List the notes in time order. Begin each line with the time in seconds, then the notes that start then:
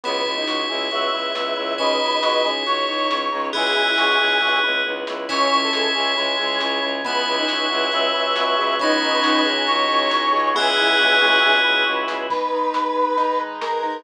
0.03 C#2 B3 E4 F#4 G#4 C#5, closed hi-hat
0.26 C#2 E4, kick
0.37 D#4
0.47 C#2 F#4, snare
0.69 C#2 E4 G#4
0.91 C#2 B3 E4 F#4 G#4 B4 E5, closed hi-hat
1.13 C#2 E4
1.35 C#2 B3, snare
1.57 C#2 E4
1.78 C#2 C#4 D#4 E4 F#4 G#4 B4 C#5 D#5, kick, closed hi-hat
2.01 C#2 D#4
2.23 C#2 F#4, snare
2.44 C#2 G#4
2.66 C#2 C#4 D#4 F#4 G#4 C#5, closed hi-hat
2.88 C#2 D#4
3.10 C#2 C#4, snare
3.32 C#2 D#4
3.53 C#2 B3 E4 F#4 G#4, kick, closed hi-hat
3.76 C#2 E4
3.98 C#2 F#4, snare
4.20 C#2 G#4
4.42 C#2 B3 E4 F#4 G#4 B4, kick, floor tom
4.63 C#2 E4, mid tom
4.85 C#2 B3, high tom
5.07 C#2 E4, snare
5.29 C#2 C#4 E4 C#5 E5 G#5, kick, crash
5.51 C#2 E4
5.63 A4
5.73 C#2 G#4, snare
5.95 C#2 C#4 G#4
6.17 C#2 G#3 E4 G#4 C#5 G#5, closed hi-hat
6.39 C#2 G#4
6.60 C#2 C#4, snare
6.82 C#2 E4
7.04 C#2 B3 E4 B4 C#5 E5 F#5 G#5, kick, closed hi-hat
7.26 C#2 E4
7.38 D#4
7.48 C#2 F#4, snare
7.70 C#2 E4 G#4
7.91 C#2 B3 B4 E5 G#5 B5, closed hi-hat
8.14 C#2 E4
8.36 C#2 F#4, snare
8.58 C#2 G#4
8.79 C#2 B3 C#4 D#4 E4 C#5 D#5 F#5 G#5, kick, closed hi-hat
9.02 C#2 D#4
9.23 C#2 F#4, snare
9.45 C#2 G#4
9.66 C#2 C#4 C#5 D#5 G#5 C#6, closed hi-hat
9.89 C#2 D#4
10.11 C#2 F#4, snare
10.33 C#2 G#4
10.54 C#2 B3 E4 G#4 B4 E5 F#5 G#5, kick, floor tom
10.77 C#2 E4, floor tom
10.99 C#2 F#4, mid tom
11.21 C#2 G#4, mid tom
11.42 C#2 B3 B4 E5 G#5 B5, high tom
11.64 C#2 E4
11.86 C#2 F#4
12.08 C#2 G#4, snare
12.29 G#3 B3 D#4 B4, kick, crash
12.52 D#4
12.73 B4, snare
12.96 G#3
13.17 D#3 G#3 D#4, closed hi-hat
13.39 B4
13.61 G#3 A#4, snare
13.83 D#4